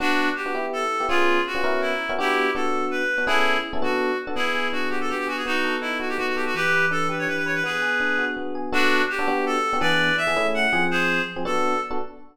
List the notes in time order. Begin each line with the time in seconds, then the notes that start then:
0.00 B3 D4 F#4
0.36 G4
0.46 B3 D4 F#4
0.55 B3 E4 G4
0.73 A4
1.00 B3 E4 G4
1.09 B3 C#4 F4 G#4
1.47 F#4
1.55 B3 C#4 F4 G#4
1.64 B3 C#4 E4 F#4 A#4
1.81 E4
2.09 B3 C#4 E4 F#4 A#4
2.18 B3 D4 E4 F#4 G4
2.55 B3 D4 F#4 A4
2.91 B4
3.18 B3 D4 F#4
3.27 B3 C#4 E4 G#4 A4
3.73 B3 C#4 E4 G#4 A4
3.82 B3 D4 F#4 A4
4.27 B3 D4 F#4 A4
4.36 B3 E4 G#4
4.55 G#4
4.72 D4 F#4
4.90 F#4 G4
5.01 A4
5.10 B3 G4
5.19 G4
5.27 F#4 G#4
5.37 G#4
5.46 B3 D#4 F#4
5.64 A4
5.81 D#4 E4
6.00 F#4
6.09 G4
6.18 B3 F#4
6.27 F#4
6.36 G4 A4
6.46 F#4
6.55 E3 G4 B4
6.73 B4
6.91 D4 A4
7.09 G4 B4
7.19 C#5
7.27 E3 B4
7.37 B4
7.46 B4 C#5
7.55 B4
7.64 B3 G#4 B4
7.82 G#4
8.00 D4
8.18 F#4
8.37 B3
8.55 G#4
8.72 B3 D4 F#4 A4
9.10 G4
9.19 B3 D4 F#4 A4
9.28 B3 D4 F#4 G4
9.46 A4
9.73 B3 D4 F#4 G4
9.81 E3 B3 D4 G#4 B4 D5
10.17 E5
10.27 E3 B3 D4 G#4
10.36 A3 C#4 E4 G#4
10.54 F#5
10.73 F3 C4 G#4
10.91 G#4 C5
11.36 F3 C4 G#4
11.45 B3 D4 F#4 A4
11.91 B3 D4 F#4 A4